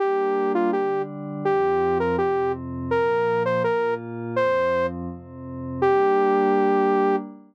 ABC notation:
X:1
M:4/4
L:1/8
Q:1/4=165
K:Gm
V:1 name="Lead 2 (sawtooth)"
G3 F G2 z2 | G3 B G2 z2 | B3 c B2 z2 | c3 z5 |
G8 |]
V:2 name="Pad 5 (bowed)"
[G,B,D]4 [D,G,D]4 | [F,,F,C]4 [F,,C,C]4 | [B,,F,B,]4 [B,,B,F]4 | [F,,F,C]4 [F,,C,C]4 |
[G,B,D]8 |]